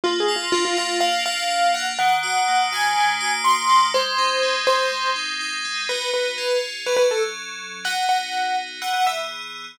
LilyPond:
<<
  \new Staff \with { instrumentName = "Acoustic Grand Piano" } { \time 4/4 \key aes \mixolydian \tempo 4 = 123 \tuplet 3/2 { f'8 aes'8 f'8 } f'16 f'16 f'8 f''8 f''4 ges''16 r16 | ges''4. aes''4. c'''4 | c''4. c''4 r4. | \key b \mixolydian b'8 b'4 r8 b'16 b'16 a'16 r4 r16 |
fis''8 fis''4 r8 fis''16 fis''16 e''16 r4 r16 | }
  \new Staff \with { instrumentName = "Electric Piano 2" } { \time 4/4 \key aes \mixolydian bes8 f'8 d'8 f'8 bes8 f'8 f'8 d'8 | ees8 ges'8 bes8 ges'8 ees8 ges'8 ges'8 bes8 | aes8 ees'8 c'8 ees'8 aes8 ees'8 ees'8 c'8 | \key b \mixolydian <b dis' fis'>4 <cis' eis' gis'>4 <fis cis' a'>2 |
<b dis' fis'>2 <e b gis'>2 | }
>>